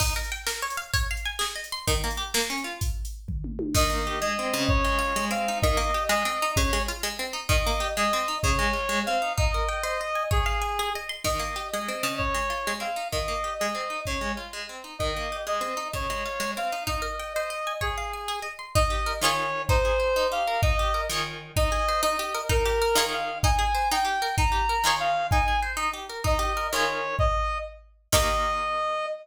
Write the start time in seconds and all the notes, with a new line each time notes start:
0.00 D#4, kick, crash
0.16 A#4
0.24 closed hi-hat
0.32 G5
0.47 A#4, snare
0.62 C#5
0.70 closed hi-hat
0.77 F5
0.94 C#5, kick, closed hi-hat
1.11 F5
1.17 closed hi-hat
1.26 G#5
1.39 G#4, snare
1.56 D#5
1.64 closed hi-hat
1.72 C6
1.88 D#3, kick, closed hi-hat
2.04 A#3
2.11 closed hi-hat
2.17 G4
2.34 A#3, snare
2.50 C#4
2.58 closed hi-hat
2.64 F4
2.81 kick, closed hi-hat
3.05 closed hi-hat
3.28 kick, floor tom
3.44 mid tom
3.59 high tom
3.74 D#3 D#5, kick, crash
3.90 A#3
4.07 G4
4.21 G#3 D#5
4.39 C4
4.54 C#3
4.69 C#5, kick
4.85 G#3
4.99 F4
5.16 G#3
5.31 C4 F5
5.48 D#4
5.62 D#3 D#5, kick
5.77 A#3
5.94 G4
6.09 G#3 D#5
6.25 C4
6.42 D#4
6.56 C#3 C#5, kick
6.73 G#3
6.88 F4
7.03 G#3
7.19 C4
7.33 D#4
7.49 D#3 D#5, kick
7.67 A#3
7.80 G4
7.97 G#3 D#5
8.13 C4
8.28 D#4
8.43 C#3 C#5, kick
8.59 G#3
8.73 F4
8.89 G#3
9.06 C4 F5
9.22 D#4
9.38 D#4 D#5, kick
9.54 A#4
9.69 G5
9.83 C5 D#5
10.01 D#5
10.15 G#5
10.31 G#4 C#5, kick
10.46 F5
10.62 G#5
10.79 G#4
10.95 D#5
11.09 C6
11.24 D#3 D#5, kick, crash
11.39 A#3
11.56 G4
11.72 G#3 D#5
11.88 C4
12.03 C#3
12.18 C#5, kick
12.34 G#3
12.50 F4
12.67 G#3
12.80 C4 F5
12.96 D#4
13.12 D#3 D#5, kick
13.28 A#3
13.44 G4
13.59 G#3 D#5
13.75 C4
13.90 D#4
14.05 C#3 C#5, kick
14.21 G#3
14.37 F4
14.53 G#3
14.69 C4
14.84 D#4
14.99 D#3 D#5, kick
15.16 A#3
15.32 G4
15.47 G#3 D#5
15.61 C4
15.77 D#4
15.93 C#3 C#5, kick
16.10 G#3
16.26 F4
16.40 G#3
16.57 C4 F5
16.72 D#4
16.87 D#4 D#5, kick
17.02 A#4
17.19 G5
17.34 C5 D#5
17.50 D#5
17.67 G#5
17.81 G#4 C#5, kick
17.98 F5
18.13 G#5
18.28 G#4
18.42 D#5
18.59 C6
18.75 D#4 D#5, kick
18.90 G4
19.06 A#4
19.21 D#3 F4 G#4 C#5
19.69 D#4 C5, kick
19.85 G#4
20.00 C5
20.16 D#4
20.32 G4 F5
20.47 A#4
20.62 D#4 D#5, kick
20.79 G4
20.94 A#4
21.10 D#3 F4 G#4 C#5
21.56 D#4 D#5, kick
21.72 G#4
21.89 C5
22.03 D#4 D#5
22.19 G4
22.35 A#4
22.49 D#4 A#4, kick
22.65 G4
22.82 A#4
22.95 D#3 F4 G#4 C#5
23.13 F5
23.43 D#4 G#5, kick
23.59 G#4
23.75 C5
23.91 D#4 G5
24.05 G4
24.22 A#4
24.38 D#4 A#5, kick
24.52 G4
24.69 A#4
24.84 D#3 F4 G#4 C#5
25.00 F5
25.31 D#4 G#5, kick
25.48 G#4
25.62 C5
25.77 D#4
25.93 G4
26.09 A#4
26.24 D#4 D#5, kick
26.39 G4
26.57 A#4
26.72 D#3 F4 G#4 C#5
27.19 D#5, kick
28.12 D#3 A#3 G4 D#5, kick, crash